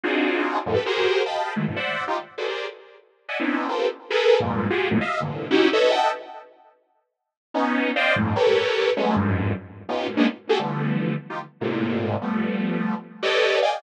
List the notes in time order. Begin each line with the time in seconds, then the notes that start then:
0.03 C4 D4 D#4 F4 F#4 G#4
0.66 F2 F#2 G#2 A2
0.74 G4 A4 B4
0.86 F#4 G4 G#4 A#4 C5
1.26 D#5 F5 G5 A5 B5
1.56 D#3 E3 F#3 G#3 A3
1.68 F#2 G2 A2 B2
1.76 C5 D5 E5 F#5
2.08 D#4 F4 G4
2.38 F#4 G#4 A4 B4 C5 D5
2.48 G4 G#4 A#4 C5 D5
3.29 D5 D#5 E5 F#5 G#5
3.40 B3 C4 C#4 D4 D#4 E4
3.68 F4 G4 A4 A#4 B4 C5
4.10 G#4 A4 A#4 B4
4.40 F2 G2 G#2 A#2
4.70 F4 F#4 G4 G#4
4.91 E2 F2 F#2 G#2 A2 A#2
5.01 D#5 E5 F5
5.20 G2 A2 A#2 C3 D3 E3
5.51 C#4 D#4 E4 F#4 G4
5.73 A4 B4 C#5 D#5 E5
5.91 D#5 E5 F#5 G5 A5
7.54 B3 C#4 D#4
7.96 C5 D5 D#5 F5 G5
8.16 F2 G2 G#2 A2
8.36 G4 A4 A#4 B4 C#5
8.97 F#3 G#3 A3 B3 C#4
9.16 F2 F#2 G2 G#2
9.89 B3 C#4 D#4 F4 G4
10.07 F#2 G#2 A2 B2
10.17 G#3 A#3 B3 C#4 D4 D#4
10.49 F#4 G4 G#4 A4
10.59 D3 E3 F3 G3 A3 B3
11.30 D#4 F4 G4
11.61 G#2 A2 A#2 C3
12.22 F3 G3 A3 B3
13.23 G4 A4 B4 C#5 D5 D#5
13.62 D5 D#5 F5 G5 G#5